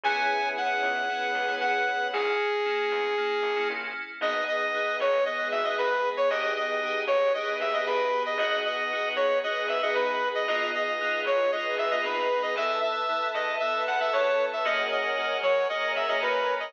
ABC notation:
X:1
M:4/4
L:1/16
Q:1/4=115
K:B
V:1 name="Lead 2 (sawtooth)"
g4 f8 f4 | G14 z2 | [K:G#m] d2 d4 c2 d2 e d B3 c | d2 d4 c2 d2 e d B3 d |
d2 d4 c2 d2 e d B3 d | d2 d4 c2 d2 e d B3 d | e2 e4 d2 e2 f e c3 e | d2 d4 c2 d2 e d B3 d |]
V:2 name="Electric Piano 2"
[B,CEG]4 [B,CEG]4 [B,CEG]3 [B,CEG] [B,CEG]4 | [A,CE]4 [A,CE]4 [A,CE]3 [A,CE] [A,CE]4 | [K:G#m] [B,DG]4 [B,DG]4 [B,DG]3 [B,DG] [B,DG]4 | [B,D=G^G]4 [B,D=G^G]4 [B,D=G^G]3 [B,D=G^G] [B,D=G^G]4 |
[B,DFG]4 [B,DFG]4 [B,DFG]3 [B,DFG] [B,DFG]4 | [B,D^EG]4 [B,DEG]4 [B,DEG]3 [B,DEG] [B,DEG]4 | [B,E=A]4 [B,EA]4 [B,EA]3 [B,EA] [B,EA]4 | [A,CFG]4 [A,CFG]4 [A,CFG]3 [A,CFG] [A,CFG]4 |]
V:3 name="Electric Bass (finger)" clef=bass
C,,6 C,,4 C,,2 C,4 | A,,,6 E,,4 A,,,2 A,,,4 | [K:G#m] G,,,6 G,,,4 G,,,2 G,,,4 | G,,,6 G,,,4 D,,2 G,,,4 |
G,,,6 D,,4 G,,,2 G,,4 | G,,,6 G,,,4 G,,,2 G,,,4 | E,,6 E,,4 E,,2 E,,4 | F,,6 F,4 F,,2 F,,4 |]
V:4 name="String Ensemble 1"
[B,CEG]8 [B,CGB]8 | z16 | [K:G#m] [B,DG]8 [G,B,G]8 | [B,D=G^G]8 [B,DGB]8 |
[B,DFG]8 [B,DGB]8 | [B,D^EG]8 [B,DGB]8 | [Be=a]8 [=ABa]8 | [Acfg]8 [Acga]8 |]